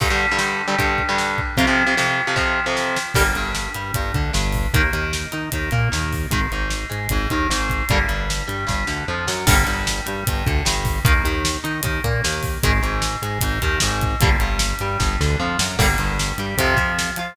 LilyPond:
<<
  \new Staff \with { instrumentName = "Overdriven Guitar" } { \time 4/4 \key g \phrygian \tempo 4 = 152 <g, d g>16 <g, d g>8 <g, d g>16 <g, d g>8. <g, d g>16 <g, d g>8. <g, d g>4~ <g, d g>16 | <f, c f>16 <f, c f>8 <f, c f>16 <f, c f>8. <f, c f>16 <f, c f>8. <f, c f>4~ <f, c f>16 | <d g bes>16 r16 g,4 g8 g,8 d8 g,4 | <ees bes>16 r16 ees4 ees'8 ees8 bes8 ees4 |
<ees aes>16 r16 aes,4 aes8 aes,8 ees8 aes,4 | <d g bes>16 r16 g,4 g8 g,8 d8 f8 fis8 | <d g bes>16 r16 g,4 g8 g,8 d8 g,4 | <ees bes>16 r16 ees4 ees'8 ees8 bes8 ees4 |
<ees aes>16 r16 aes,4 aes8 aes,8 ees8 aes,4 | <d g bes>16 r16 g,4 g8 g,8 d8 f8 fis8 | <d g bes>16 r16 g,4 g8 <c f>8 f4 f'8 | }
  \new Staff \with { instrumentName = "Synth Bass 1" } { \clef bass \time 4/4 \key g \phrygian r1 | r1 | g,,8 g,,4 g,8 g,,8 d,8 g,,4 | ees,8 ees,4 ees8 ees,8 bes,8 ees,4 |
aes,,8 aes,,4 aes,8 aes,,8 ees,8 aes,,4 | g,,8 g,,4 g,8 g,,8 d,8 f,8 fis,8 | g,,8 g,,4 g,8 g,,8 d,8 g,,4 | ees,8 ees,4 ees8 ees,8 bes,8 ees,4 |
aes,,8 aes,,4 aes,8 aes,,8 ees,8 aes,,4 | g,,8 g,,4 g,8 g,,8 d,8 f,8 fis,8 | g,,8 g,,4 g,8 f,8 f,4 f8 | }
  \new DrumStaff \with { instrumentName = "Drums" } \drummode { \time 4/4 <cymc bd>4 sn4 <hh bd>8 bd8 sn8 bd8 | <hh bd>4 sn4 <bd sn>4 sn8 sn8 | <cymc bd>8 hh8 sn8 hh8 <hh bd>8 <hh bd>8 sn8 <hho bd>8 | <hh bd>8 hh8 sn8 hh8 <hh bd>8 <hh bd>8 sn8 <hho bd>8 |
<hh bd>8 hh8 sn8 hh8 <hh bd>8 <hh bd>8 sn8 <hh bd>8 | <hh bd>8 hh8 sn8 hh8 <bd sn>8 sn8 r8 sn8 | <cymc bd>8 hh8 sn8 hh8 <hh bd>8 <hh bd>8 sn8 <hho bd>8 | <hh bd>8 hh8 sn8 hh8 <hh bd>8 <hh bd>8 sn8 <hho bd>8 |
<hh bd>8 hh8 sn8 hh8 <hh bd>8 <hh bd>8 sn8 <hh bd>8 | <hh bd>8 hh8 sn8 hh8 <bd sn>8 sn8 r8 sn8 | <cymc bd>8 hh8 sn8 hh8 <hh bd>8 <hh bd>8 sn8 hh8 | }
>>